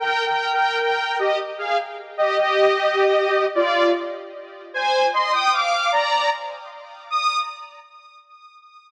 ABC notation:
X:1
M:3/4
L:1/16
Q:1/4=76
K:Eb
V:1 name="Lead 2 (sawtooth)"
(3[Bg]2 [Bg]2 [Bg]2 [Bg]2 [Ge] z [Af] z2 [Ge] | [Ge]6 [Fd]2 z4 | [ca]2 [ec'] [ge'] [fd']2 [db]2 z4 | e'4 z8 |]